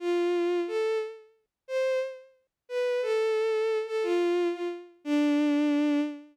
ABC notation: X:1
M:6/8
L:1/8
Q:3/8=119
K:Dm
V:1 name="Violin"
F4 A2 | z4 c2 | z4 =B2 | A5 A |
F3 F z2 | D6 |]